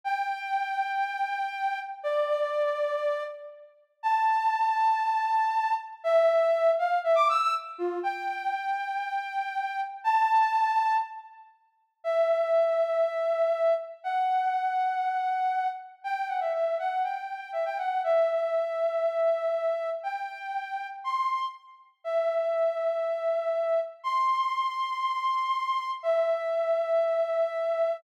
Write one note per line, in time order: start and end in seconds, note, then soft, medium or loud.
0.04 1.79 G5 loud
2.03 3.24 D5 loud
4.03 5.74 A5 loud
6.04 6.71 E5 loud
6.79 6.99 F5 loud
7.04 7.16 E5 loud
7.15 7.27 D6 loud
7.29 7.41 E6 loud
7.41 7.53 E6 loud
7.78 7.99 F4 loud
8.03 9.81 G5 loud
10.04 10.97 A5 loud
12.04 13.74 E5 loud
14.04 15.68 F#5 loud
16.04 16.28 G5 loud
16.28 16.40 F#5 medium
16.41 16.52 E5 medium
16.54 16.77 E5 medium
16.79 17.02 F#5 medium
17.04 17.51 G5 medium
17.53 17.65 E5 medium
17.65 17.77 G5 loud
17.78 18.02 F#5 medium
18.04 19.90 E5 loud
20.03 20.87 G5 loud
21.04 21.45 C6 loud
22.04 23.80 E5 loud
24.04 25.91 C6 loud
26.03 27.97 E5 loud